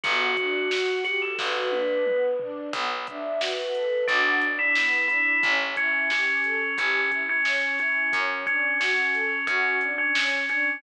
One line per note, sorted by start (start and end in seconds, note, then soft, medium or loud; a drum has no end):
0.04 1.28 G1 loud
0.04 0.34 B3 loud
0.04 0.93 F#4 loud
0.04 kick medium
0.04 closed hi-hat medium
0.37 0.68 D4 medium
0.37 kick medium
0.37 closed hi-hat medium
0.71 1.03 F#4 medium
0.71 snare medium
1.04 1.20 F#4 loud
1.04 1.35 G4 medium
1.04 snare soft
1.04 closed hi-hat medium
1.22 1.38 A4 loud
1.38 2.63 G1 medium
1.38 1.68 F#4 loud
1.38 2.21 B4 medium
1.38 kick medium
1.38 snare medium
1.72 2.03 D4 medium
1.72 high tom medium
2.06 2.36 B3 medium
2.06 mid tom medium
2.39 2.71 D4 medium
2.39 floor tom medium
2.73 3.97 B1 loud
2.73 3.04 B3 loud
2.73 kick medium
2.73 closed hi-hat medium
3.07 3.38 D4 loud
3.07 3.36 E5 loud
3.07 kick medium
3.07 closed hi-hat medium
3.40 3.70 F#4 medium
3.40 3.97 B4 loud
3.40 snare medium
3.74 4.04 A4 medium
3.74 closed hi-hat medium
4.07 5.32 B1 loud
4.07 4.36 D4 loud
4.07 4.38 F#4 medium
4.07 kick medium
4.07 closed hi-hat medium
4.41 4.73 D4 medium
4.41 closed hi-hat medium
4.59 5.05 E4 loud
4.75 5.06 B3 medium
4.75 snare medium
5.08 5.40 D4 medium
5.08 5.41 E4 loud
5.08 closed hi-hat medium
5.43 6.67 A1 loud
5.43 5.74 C#4 loud
5.43 kick medium
5.43 closed hi-hat medium
5.76 6.09 C#4 medium
5.76 6.08 E4 medium
5.76 kick medium
5.76 closed hi-hat medium
6.10 6.75 C#4 loud
6.10 6.41 G4 medium
6.10 snare medium
6.44 6.75 A4 medium
6.44 closed hi-hat medium
6.78 8.02 A1 medium
6.78 7.10 C#4 loud
6.78 7.09 G4 medium
6.78 kick medium
6.78 closed hi-hat medium
7.11 7.41 E4 medium
7.11 kick medium
7.11 closed hi-hat medium
7.29 7.71 C#4 loud
7.45 7.75 C#4 medium
7.45 snare medium
7.79 8.12 C#4 loud
7.79 8.10 E4 medium
7.79 closed hi-hat medium
8.13 9.37 F#2 loud
8.13 8.43 C#4 loud
8.13 kick medium
8.13 closed hi-hat medium
8.46 8.79 C#4 loud
8.46 8.77 D4 medium
8.46 kick medium
8.46 closed hi-hat medium
8.80 9.39 C#4 loud
8.80 9.11 F#4 medium
8.80 snare medium
9.13 9.44 A4 medium
9.13 closed hi-hat medium
9.47 10.71 F#2 medium
9.47 9.76 C#4 loud
9.47 9.78 F#4 loud
9.47 kick medium
9.47 closed hi-hat medium
9.81 10.11 D4 medium
9.81 closed hi-hat medium
9.98 10.41 C#4 medium
10.15 10.46 C#4 medium
10.15 snare loud
10.49 10.78 C#4 medium
10.49 10.79 D4 medium
10.49 closed hi-hat medium